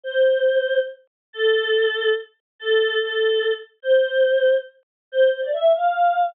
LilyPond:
\new Staff { \time 6/8 \key c \major \tempo 4. = 95 c''2 r4 | \key a \minor a'2 r4 | a'4 a'4. r8 | c''2 r4 |
c''8 c''16 d''16 e''8 f''4. | }